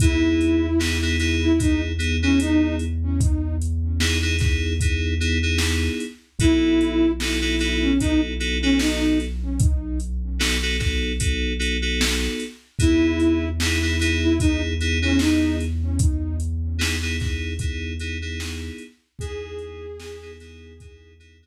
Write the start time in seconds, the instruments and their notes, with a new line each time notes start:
0.00 synth bass 1 E2, electric piano 2 B3 D#4 E4 G#4, flute E4, kick, closed hi-hat
0.41 closed hi-hat
0.79 electric piano 2 B3 D#4 E4 G#4, snare
1.02 electric piano 2 B3 D#4 E4 G#4
1.20 electric piano 2 B3 D#4 E4 G#4, snare, closed hi-hat
1.43 flute E4
1.59 electric piano 2 B3 D#4 E4 G#4, flute D#4, kick, closed hi-hat
1.99 electric piano 2 B3 D#4 E4 G#4, closed hi-hat
2.23 electric piano 2 B3 D#4 E4 G#4, flute C#4
2.40 flute D#4, closed hi-hat
2.79 closed hi-hat
3.21 kick, closed hi-hat
3.62 closed hi-hat
4.00 electric piano 2 B3 D#4 E4 G#4, snare
4.22 electric piano 2 B3 D#4 E4 G#4
4.39 electric piano 2 B3 D#4 E4 G#4, kick, snare, closed hi-hat
4.80 electric piano 2 B3 D#4 E4 G#4, kick, closed hi-hat
5.20 electric piano 2 B3 D#4 E4 G#4, closed hi-hat
5.43 electric piano 2 B3 D#4 E4 G#4
5.58 snare
6.00 closed hi-hat
6.39 synth bass 1 B1, electric piano 2 B3 D#4 F#4 A4, flute E4, kick, closed hi-hat
6.81 closed hi-hat
7.20 electric piano 2 B3 D#4 F#4 A4, snare
7.42 electric piano 2 B3 D#4 F#4 A4
7.59 electric piano 2 B3 D#4 F#4 A4, snare, closed hi-hat
7.82 flute C#4
8.00 electric piano 2 B3 D#4 F#4 A4, flute D#4, kick, closed hi-hat
8.40 electric piano 2 B3 D#4 F#4 A4, closed hi-hat
8.62 electric piano 2 B3 D#4 F#4 A4, flute C#4
8.79 flute D#4, snare
9.20 closed hi-hat
9.60 kick, closed hi-hat
10.00 closed hi-hat
10.39 electric piano 2 B3 D#4 F#4 A4, snare
10.62 electric piano 2 B3 D#4 F#4 A4
10.79 electric piano 2 B3 D#4 F#4 A4, kick, snare, closed hi-hat
11.20 electric piano 2 B3 D#4 F#4 A4, kick, closed hi-hat
11.59 electric piano 2 B3 D#4 F#4 A4, closed hi-hat
11.82 electric piano 2 B3 D#4 F#4 A4
12.01 snare
12.40 closed hi-hat
12.79 synth bass 1 E2, electric piano 2 B3 D#4 E4 G#4, flute E4, kick, closed hi-hat
13.20 closed hi-hat
13.60 electric piano 2 B3 D#4 E4 G#4, snare
13.82 electric piano 2 B3 D#4 E4 G#4
13.99 electric piano 2 B3 D#4 E4 G#4, snare, closed hi-hat
14.23 flute E4
14.40 electric piano 2 B3 D#4 E4 G#4, flute D#4, kick, closed hi-hat
14.81 electric piano 2 B3 D#4 E4 G#4, closed hi-hat
15.02 electric piano 2 B3 D#4 E4 G#4, flute C#4
15.19 flute D#4, snare
15.61 closed hi-hat
15.99 kick, closed hi-hat
16.40 closed hi-hat
16.79 electric piano 2 B3 D#4 E4 G#4, snare
17.02 electric piano 2 B3 D#4 E4 G#4
17.20 electric piano 2 B3 D#4 E4 G#4, kick, snare, closed hi-hat
17.59 electric piano 2 B3 D#4 E4 G#4, kick, closed hi-hat
18.00 electric piano 2 B3 D#4 E4 G#4, closed hi-hat
18.22 electric piano 2 B3 D#4 E4 G#4
18.40 snare
18.78 closed hi-hat
19.19 synth bass 1 E2, electric piano 2 B3 D#4 E4 G#4, flute G#4, kick, closed hi-hat
19.58 closed hi-hat
20.00 electric piano 2 B3 D#4 E4 G#4, snare
20.22 electric piano 2 B3 D#4 E4 G#4
20.40 electric piano 2 B3 D#4 E4 G#4, snare, closed hi-hat
20.80 electric piano 2 B3 D#4 E4 G#4, kick, closed hi-hat
21.20 electric piano 2 B3 D#4 E4 G#4, closed hi-hat
21.42 electric piano 2 B3 D#4 E4 G#4